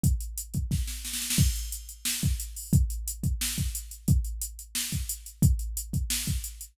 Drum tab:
CC |----------------|x---------------|----------------|----------------|
HH |x-x-x-x---------|--x-x-x---x-x-o-|x-x-x-x---x-x-x-|x-x-x-x---x-x-x-|
SD |--------o-o-oooo|--------o-------|--------o-------|--------o-------|
BD |o-----o-o-------|o---------o-----|o-----o---o-----|o---------o-----|

CC |----------------|
HH |x-x-x-x---x-x-x-|
SD |--------o-------|
BD |o-----o---o-----|